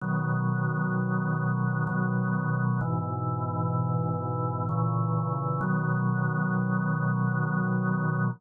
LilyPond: \new Staff { \clef bass \time 3/4 \key b \major \tempo 4 = 64 <b, dis fis>2 <b, dis fis>4 | <gis, b, e>2 <ais, cis e>4 | <b, dis fis>2. | }